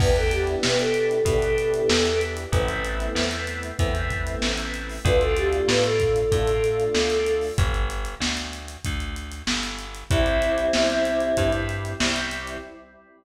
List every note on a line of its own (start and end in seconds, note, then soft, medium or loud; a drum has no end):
0.00 0.56 E2 medium
0.00 1.14 B3 loud
0.00 1.14 D4 loud
0.00 1.14 E4 loud
0.00 1.14 G4 loud
0.00 0.15 B4 medium
0.00 kick loud
0.00 crash loud
0.16 0.31 A4 medium
0.16 closed hi-hat medium
0.31 0.58 G4 medium
0.31 closed hi-hat loud
0.47 closed hi-hat medium
0.63 1.21 B2 medium
0.63 0.78 B4 medium
0.63 snare loud
0.79 2.20 A4 medium
0.79 closed hi-hat medium
0.94 closed hi-hat medium
1.11 closed hi-hat medium
1.25 1.82 B2 medium
1.25 2.40 B3 medium
1.25 2.40 D4 medium
1.25 2.40 E4 medium
1.25 2.40 G4 medium
1.25 kick loud
1.25 closed hi-hat loud
1.42 closed hi-hat medium
1.58 closed hi-hat medium
1.74 closed hi-hat medium
1.89 2.46 E2 medium
1.89 snare loud
2.05 closed hi-hat medium
2.21 closed hi-hat medium
2.37 closed hi-hat medium
2.52 3.09 A1 medium
2.52 3.67 A3 loud
2.52 3.67 B3 loud
2.52 3.67 C4 loud
2.52 3.67 E4 loud
2.52 kick loud
2.52 closed hi-hat loud
2.68 closed hi-hat medium
2.85 closed hi-hat medium
3.00 closed hi-hat medium
3.15 3.72 E2 medium
3.15 snare loud
3.31 closed hi-hat medium
3.47 closed hi-hat medium
3.63 closed hi-hat medium
3.79 4.36 E2 medium
3.79 4.93 A3 loud
3.79 4.93 B3 medium
3.79 4.93 C4 loud
3.79 4.93 E4 medium
3.79 kick loud
3.79 closed hi-hat loud
3.95 closed hi-hat medium
4.11 kick medium
4.11 closed hi-hat medium
4.27 closed hi-hat medium
4.42 4.99 A1 medium
4.42 snare loud
4.58 closed hi-hat medium
4.74 closed hi-hat medium
4.89 open hi-hat medium
5.05 5.62 D2 loud
5.05 6.19 A3 loud
5.05 6.19 D4 loud
5.05 6.19 F4 loud
5.05 5.20 B4 medium
5.05 kick loud
5.05 closed hi-hat loud
5.21 5.36 A4 medium
5.21 closed hi-hat medium
5.37 5.67 G4 medium
5.37 closed hi-hat medium
5.53 closed hi-hat medium
5.68 6.25 A2 medium
5.68 5.83 B4 medium
5.68 snare loud
5.84 7.43 A4 medium
5.84 closed hi-hat medium
6.00 kick medium
6.00 closed hi-hat medium
6.16 closed hi-hat medium
6.32 6.89 A2 medium
6.32 7.46 A3 medium
6.32 7.46 D4 loud
6.32 7.46 F4 medium
6.32 kick loud
6.32 closed hi-hat loud
6.48 closed hi-hat medium
6.64 closed hi-hat medium
6.80 closed hi-hat medium
6.94 7.51 D2 medium
6.94 snare loud
7.10 closed hi-hat medium
7.26 closed hi-hat medium
7.41 open hi-hat medium
7.58 8.15 G1 medium
7.58 kick loud
7.58 closed hi-hat loud
7.74 closed hi-hat medium
7.90 closed hi-hat loud
8.05 closed hi-hat medium
8.20 8.77 D2 medium
8.20 snare loud
8.37 closed hi-hat medium
8.53 closed hi-hat medium
8.68 closed hi-hat medium
8.85 9.42 D2 medium
8.85 kick medium
8.85 closed hi-hat loud
9.00 closed hi-hat medium
9.16 closed hi-hat medium
9.32 closed hi-hat medium
9.47 10.04 G1 medium
9.47 snare loud
9.63 closed hi-hat medium
9.79 closed hi-hat medium
9.95 closed hi-hat medium
10.10 10.68 C2 medium
10.10 10.67 G3 loud
10.10 10.67 C4 loud
10.10 11.50 C4 medium
10.10 10.67 E4 loud
10.10 11.50 E4 medium
10.10 kick loud
10.10 closed hi-hat loud
10.26 closed hi-hat medium
10.42 closed hi-hat medium
10.58 closed hi-hat medium
10.73 11.32 C2 medium
10.73 11.31 G3 medium
10.73 11.31 C4 medium
10.73 11.31 E4 medium
10.73 snare loud
10.90 closed hi-hat medium
11.05 closed hi-hat medium
11.20 closed hi-hat medium
11.37 11.94 G2 medium
11.37 11.94 G3 medium
11.37 11.94 C4 loud
11.37 11.94 E4 medium
11.37 kick medium
11.37 closed hi-hat loud
11.53 closed hi-hat medium
11.69 closed hi-hat medium
11.85 closed hi-hat medium
12.00 12.57 C2 medium
12.00 12.57 G3 medium
12.00 12.57 C4 loud
12.00 12.57 E4 loud
12.00 snare loud
12.16 closed hi-hat medium
12.31 closed hi-hat medium
12.47 closed hi-hat medium